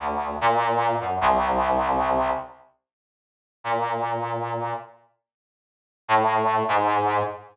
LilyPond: \new Staff { \clef bass \time 6/8 \tempo 4. = 99 d,4 bes,4. ges,8 | c,2. | r2. | bes,2. |
r2. | a,4. aes,4. | }